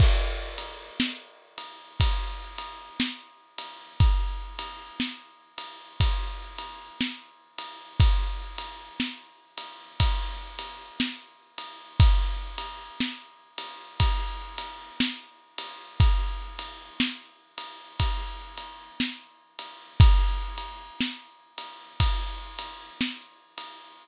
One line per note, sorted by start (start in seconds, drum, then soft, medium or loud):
0.00 kick loud
0.00 crash loud
0.58 ride medium
1.00 snare loud
1.58 ride medium
2.00 kick medium
2.00 ride loud
2.58 ride medium
3.00 snare loud
3.58 ride medium
4.00 kick loud
4.00 ride medium
4.59 ride medium
5.00 snare loud
5.58 ride medium
6.00 kick medium
6.00 ride loud
6.58 ride medium
7.01 snare loud
7.58 ride medium
8.00 kick loud
8.00 ride loud
8.58 ride medium
9.00 snare loud
9.57 ride medium
10.00 kick medium
10.00 ride loud
10.59 ride medium
11.00 snare loud
11.58 ride medium
12.00 kick loud
12.00 ride loud
12.58 ride medium
13.00 snare loud
13.58 ride medium
14.00 kick medium
14.00 ride loud
14.58 ride medium
15.00 snare loud
15.58 ride medium
16.00 kick loud
16.00 ride loud
16.59 ride medium
17.00 snare loud
17.58 ride medium
18.00 kick medium
18.00 ride loud
18.57 ride medium
19.00 snare loud
19.59 ride medium
20.00 kick loud
20.00 ride loud
20.58 ride medium
21.01 snare loud
21.58 ride medium
22.00 kick medium
22.00 ride loud
22.59 ride medium
23.01 snare loud
23.58 ride medium